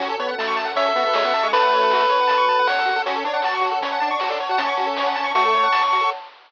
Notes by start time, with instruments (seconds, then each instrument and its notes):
0.00 synth bass 1 F#2, lead 1 (square) C#4 F#4, pad 2 (warm) C#4 F#4 A4, kick, closed hi-hat
0.09 lead 1 (square) A4
0.19 lead 1 (square) B3 C#5, kick, closed hi-hat
0.29 lead 1 (square) F#5
0.38 lead 1 (square) A3 A5, snare
0.48 lead 1 (square) C#6
0.57 lead 1 (square) A5, closed hi-hat
0.65 lead 1 (square) F#5
0.75 lead 1 (square) C#4 C#5 E5, kick, closed hi-hat
0.86 lead 1 (square) A4
0.96 lead 1 (square) B3 F#4, kick, closed hi-hat
1.05 lead 1 (square) B3 A4
1.14 lead 1 (square) G#3 C#5, snare
1.24 lead 1 (square) B3 F#5
1.34 lead 1 (square) A5, closed hi-hat
1.43 lead 1 (square) G#3 C#6
1.52 synth bass 1 F#2, lead 1 (square) A3 B4 A5, kick, closed hi-hat
1.62 lead 1 (square) F#5
1.70 lead 1 (square) C#5, kick, closed hi-hat
1.81 lead 1 (square) A4
1.90 lead 1 (square) F#4, snare
2.00 lead 1 (square) A4
2.09 lead 1 (square) C#5, closed hi-hat
2.20 lead 1 (square) F#5
2.27 lead 1 (square) A5, kick, closed hi-hat
2.38 lead 1 (square) C#6
2.47 lead 1 (square) A5, kick, closed hi-hat
2.59 lead 1 (square) F#5
2.67 synth bass 1 E2, lead 1 (square) C#5 F#5, snare
2.79 lead 1 (square) A4
2.86 synth bass 1 F2, lead 1 (square) F#4, closed hi-hat
2.96 lead 1 (square) A4
3.06 synth bass 1 F#2, lead 1 (square) C#4 F#4, pad 2 (warm) C#5 F#5 A5, kick, closed hi-hat
3.15 lead 1 (square) A4
3.24 lead 1 (square) D4 C#5, kick, closed hi-hat
3.34 lead 1 (square) F#5
3.42 lead 1 (square) F#4 A5, snare
3.55 lead 1 (square) C#6
3.61 lead 1 (square) F#4, closed hi-hat
3.72 lead 1 (square) A4
3.81 lead 1 (square) C#4 C#5, kick, closed hi-hat
3.92 lead 1 (square) F#5
4.00 lead 1 (square) D4 A5, kick, closed hi-hat
4.11 lead 1 (square) D4 C#6
4.20 lead 1 (square) F#4, snare
4.29 lead 1 (square) D4 A4
4.40 lead 1 (square) C#5, closed hi-hat
4.49 lead 1 (square) F#4 F#5
4.58 synth bass 1 F#2, lead 1 (square) C#4 A5, kick, closed hi-hat
4.67 lead 1 (square) C#6
4.77 lead 1 (square) F#4, kick, closed hi-hat
4.87 lead 1 (square) A4
4.97 lead 1 (square) C#5, snare
5.07 lead 1 (square) F#5
5.16 lead 1 (square) A5, closed hi-hat
5.24 lead 1 (square) C#6
5.34 lead 1 (square) A3 F#4 C#6, kick, closed hi-hat
5.45 lead 1 (square) A4
5.54 lead 1 (square) C#5, kick, closed hi-hat
5.63 lead 1 (square) F#5
5.72 lead 1 (square) A5, snare
5.84 lead 1 (square) C#6
5.93 lead 1 (square) F#4, closed hi-hat
6.01 lead 1 (square) A4